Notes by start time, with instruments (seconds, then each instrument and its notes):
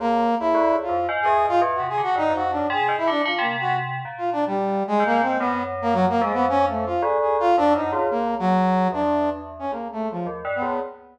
0.00 tubular bells C#2, brass section A#3
0.40 tubular bells C#2, brass section E4
0.54 tubular bells D2
0.72 tubular bells C#2
0.83 brass section F4
0.89 tubular bells F2
1.09 tubular bells G#2
1.22 tubular bells E2, brass section G#4
1.45 tubular bells G#2, brass section F4
1.62 tubular bells E2
1.75 brass section F#4
1.80 tubular bells C3
1.89 brass section G#4
1.98 tubular bells D3
2.03 brass section F#4
2.16 tubular bells G2, brass section D#4
2.30 tubular bells F2
2.35 brass section F#4
2.51 brass section D4
2.57 tubular bells F#2
2.70 tubular bells C3, brass section G#4
2.89 tubular bells G#2
2.98 brass section E4
3.07 tubular bells D3, brass section D4
3.25 tubular bells D3, brass section F4
3.39 tubular bells C3, brass section A#3
3.61 brass section F#4
4.05 tubular bells A#2
4.18 brass section F4
4.33 brass section D4
4.47 brass section G3
4.88 brass section G#3
5.00 tubular bells G#2
5.06 brass section A#3
5.22 brass section C4
5.39 tubular bells F#2, brass section B3
5.82 brass section A#3
5.93 brass section F#3
6.09 brass section A#3
6.21 tubular bells F2, brass section G#3
6.34 brass section B3
6.49 brass section C#4
6.69 brass section A3
6.86 brass section F4
7.02 tubular bells D2, brass section G#4
7.21 brass section G#4
7.40 brass section F4
7.57 tubular bells F2, brass section D4
7.75 tubular bells F#2, brass section D#4
7.92 tubular bells C#2, brass section F4
8.10 tubular bells C#2, brass section A#3
8.39 brass section F#3
8.92 tubular bells E2, brass section D4
9.59 brass section C#4
9.72 tubular bells C#2, brass section A#3
9.92 brass section A3
10.11 brass section F3
10.26 tubular bells D#2
10.45 tubular bells G2
10.55 brass section B3
10.62 tubular bells C#2